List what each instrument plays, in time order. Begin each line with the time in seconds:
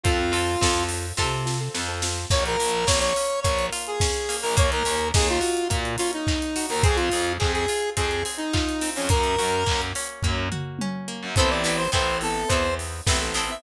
0.03 electric bass (finger) F2, acoustic guitar (steel) C4 F4 A4, acoustic grand piano C4 F4 A4, lead 1 (square) F4, kick, closed hi-hat
0.18 acoustic grand piano C4 F4 A4
0.32 acoustic guitar (steel) C4 F4 A4, open hi-hat
0.61 electric bass (finger) F2, acoustic grand piano C4 F4 A4, acoustic guitar (steel) C4 F4 A4, kick, snare
0.89 open hi-hat
1.17 electric bass (finger) C3, acoustic guitar (steel) C4 F4 A4, kick, snare
1.46 acoustic grand piano C4 F4 A4, snare
1.60 acoustic grand piano C4 F4 A4
1.74 electric bass (finger) F2, acoustic grand piano C4 F4 A4, snare
1.88 acoustic grand piano C4 F4 A4
2.02 acoustic grand piano C4 F4 A4, snare
2.30 electric bass (finger) A#1, acoustic guitar (steel) A#3, lead 1 (square) C#5, kick, crash
2.46 lead 1 (square) A#4, closed hi-hat
2.59 electric bass (finger) A#1, acoustic guitar (steel) F4, open hi-hat
2.72 closed hi-hat
2.87 electric bass (finger) A#1, acoustic guitar (steel) A#3, lead 1 (square) C#5, kick, snare
3.00 lead 1 (square) C#5, closed hi-hat
3.16 acoustic guitar (steel) C#4, open hi-hat
3.30 closed hi-hat
3.42 electric bass (finger) A#1, acoustic guitar (steel) A#3, lead 1 (square) C#5, kick, closed hi-hat
3.59 closed hi-hat
3.73 acoustic guitar (steel) F4, open hi-hat
3.87 lead 1 (square) G#4, closed hi-hat
4.00 acoustic guitar (steel) C#4, kick, snare
4.14 closed hi-hat
4.29 acoustic guitar (steel) A#3, open hi-hat
4.42 electric bass (finger) A#1, lead 1 (square) A#4, open hi-hat
4.57 electric bass (finger) D#2, acoustic guitar (steel) A#3, lead 1 (square) C#5, kick, closed hi-hat
4.72 lead 1 (square) A#4, closed hi-hat
4.85 electric bass (finger) D#2, acoustic guitar (steel) C#4, open hi-hat
5.01 closed hi-hat
5.14 electric bass (finger) D#2, acoustic guitar (steel) D#4, lead 1 (square) G#4, kick, snare
5.28 lead 1 (square) F4, closed hi-hat
5.41 acoustic guitar (steel) F#4, open hi-hat
5.57 closed hi-hat
5.70 electric bass (finger) A#2, acoustic guitar (steel) A#3, kick, closed hi-hat
5.85 closed hi-hat
5.98 acoustic guitar (steel) C#4, lead 1 (square) F4, open hi-hat
6.13 lead 1 (square) D#4, closed hi-hat
6.27 acoustic guitar (steel) D#4, kick, clap
6.42 closed hi-hat
6.56 acoustic guitar (steel) F#4, open hi-hat
6.69 electric bass (finger) D#2, lead 1 (square) A#4, open hi-hat
6.83 electric bass (finger) F2, acoustic guitar (steel) C4, lead 1 (square) G#4, kick, closed hi-hat
6.96 lead 1 (square) F4, closed hi-hat
7.12 electric bass (finger) F2, acoustic guitar (steel) G#4, open hi-hat
7.27 closed hi-hat
7.39 electric bass (finger) F2, acoustic guitar (steel) C4, lead 1 (square) G#4, kick, clap
7.53 lead 1 (square) G#4, closed hi-hat
7.68 acoustic guitar (steel) F4, open hi-hat
7.82 closed hi-hat
7.97 electric bass (finger) F2, acoustic guitar (steel) C4, lead 1 (square) G#4, kick, closed hi-hat
8.11 closed hi-hat
8.25 acoustic guitar (steel) G#4, open hi-hat
8.37 lead 1 (square) D#4, closed hi-hat
8.53 acoustic guitar (steel) F4, kick, clap
8.69 closed hi-hat
8.81 acoustic guitar (steel) C4, open hi-hat
8.96 electric bass (finger) F2, lead 1 (square) C#4, open hi-hat
9.09 electric bass (finger) F#2, acoustic guitar (steel) A#3, lead 1 (square) A#4, kick, closed hi-hat
9.23 closed hi-hat
9.38 electric bass (finger) F#2, acoustic guitar (steel) F#4, open hi-hat
9.52 closed hi-hat
9.66 electric bass (finger) F#2, acoustic guitar (steel) A#3, kick, clap
9.82 closed hi-hat
9.95 acoustic guitar (steel) C#4, open hi-hat
10.09 closed hi-hat
10.22 electric bass (finger) F#2, acoustic guitar (steel) A#3, kick, floor tom
10.52 acoustic guitar (steel) F#4, mid tom
10.79 acoustic guitar (steel) C#4, high tom
11.08 acoustic guitar (steel) A#3
11.23 electric bass (finger) F#2
11.36 electric bass (finger) A1, acoustic guitar (steel) B3 C4 E4 A4, acoustic grand piano B3 C4 E4 A4, lead 1 (square) C5, kick, closed hi-hat
11.50 lead 1 (square) D5
11.64 acoustic guitar (steel) B3 C4 E4 A4, open hi-hat
11.77 lead 1 (square) C5
11.92 electric bass (finger) A1, acoustic guitar (steel) B3 C4 E4 A4, lead 1 (square) C5, kick, clap
12.21 acoustic grand piano B3 C4 E4 A4, lead 1 (square) A4, open hi-hat
12.48 electric bass (finger) E2, acoustic guitar (steel) B3 C4 E4, lead 1 (square) C5, kick, closed hi-hat
12.52 acoustic guitar (steel) A4
12.79 open hi-hat
13.06 electric bass (finger) A1, acoustic grand piano B3 C4 E4 A4, acoustic guitar (steel) B3 C4 E4 A4, kick, snare
13.21 acoustic grand piano B3 C4 E4 A4
13.34 acoustic guitar (steel) B3 C4 E4 A4, open hi-hat
13.50 acoustic grand piano B3 C4 E4 A4, lead 1 (square) E5